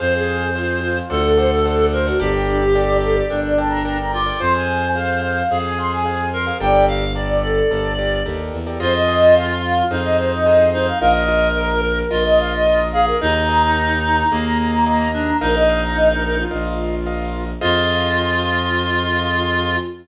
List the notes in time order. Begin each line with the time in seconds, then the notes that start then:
0.00 F2 G#4 C5 F5
0.15 G#4
0.56 F4 G#4 C5 F5
0.82 F4
1.10 D2 A4 C5 D5 F#5
1.25 A4
1.37 A4 C5 D5 F#5
1.50 A4
1.65 A4 C5 D5 F#5
1.93 A#4 C5
2.07 F#4 A4 C5 D5 F#5
2.19 G1 D4 G4 A4 A#4 D5 G5
2.34 G4
2.47 D4
2.61 G4
2.75 A4 A#4 D5 G5
3.03 A4
3.15 D5
3.30 G1 D4 A4 A#4 D5 G5
3.46 D5
3.58 A4 A#4 D5 G5 A5
3.70 A#5
3.85 A4 A#4 D5 G5 A#5
3.99 A#5
4.13 F4 D6
4.26 A4 A#4 D5 G5
4.40 F2 G#4 C5 F5 C6
4.55 G#5
4.95 G#4 C5 F5
5.22 F5
5.50 F2 G#4 C5 F5
5.65 G#5
5.78 G#4 C5 F5 C6
5.91 G#5
6.05 G#4 C5 F5
6.33 A#4 C6
6.46 G#4 C5 F5
6.60 G1 G4 A4 A#4 D5 G5
6.88 F5
7.15 G4 A4 A#4 D5
7.29 D5
7.43 A4 D5
7.70 G1 G4 A4 A#4 D5
7.99 G4 A4 A#4 D5
8.25 D#2 G4 A4 A#4 D5
8.53 E2
8.67 G4 A4 A#4 D5
8.80 F2 F4 G#4 C5 D#5
8.95 D#5
9.08 F4 G#4 C5 D#5
9.35 F5
9.65 F5
9.90 F2 D#4 F4 G#4 C5 D#5
10.03 D#5
10.19 C5
10.32 D#5
10.46 F4 G#4 C5 D#5
10.73 D#4 C5
10.86 F5
11.00 A#1 F4 A#4 D#5 F5
11.15 D#5
11.28 F4 A#4 D#5
11.55 A#4
11.85 A#4
12.11 A#1 F4 A#4 D#5
12.26 D#5
12.40 F5
12.54 D#5
12.66 F4 A#4 D#5
12.92 G#4 F5
13.07 A#4
13.21 D#2 D#4 G#4 A#4 D#5 A#5
13.35 A#5
13.49 G#4 A#4 D#5 A#5
13.63 A#5
13.77 A#5
14.03 A#5
14.18 A#5
14.31 D#2 A#3 G#4 A#4 D#5
14.45 A#5
14.58 A#5
14.72 A#5
14.86 G#4 A#4 D#5 A#5
14.99 A#5
15.12 D4 A#5
15.41 A#1 D#4 A#4 D#5 F5
15.56 D#5
15.69 A#4 D#5 F5
15.84 A#5
15.96 D#5
16.10 A#4
16.25 A#4
16.38 F4
16.51 A#1 A#4 D#5 F5
17.06 A#4 D#5 F5
17.61 F2 F4 G#4 C5 D#5 F5